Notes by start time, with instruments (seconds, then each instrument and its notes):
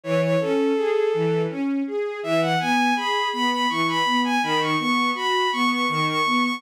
0.04 string ensemble 1 E3, violin C#5
0.22 violin C#5
0.40 string ensemble 1 C#4, violin A4
0.76 string ensemble 1 G#4
1.14 string ensemble 1 E3
1.50 string ensemble 1 C#4
1.87 string ensemble 1 G#4
2.23 string ensemble 1 E3, violin E5
2.41 violin F#5
2.60 string ensemble 1 B3, violin G#5
2.96 string ensemble 1 G#4, violin B5
3.33 string ensemble 1 B3, violin B5
3.51 violin B5
3.69 string ensemble 1 E3, violin C#6
3.87 violin B5
4.05 string ensemble 1 B3
4.24 violin G#5
4.43 string ensemble 1 D#3, violin B5
4.61 violin C#6
4.79 string ensemble 1 B3, violin C#6
5.15 string ensemble 1 F#4, violin B5
5.52 string ensemble 1 B3, violin C#6
5.70 violin C#6
5.89 string ensemble 1 D#3, violin C#6
6.07 violin C#6
6.26 string ensemble 1 B3
6.44 violin C#6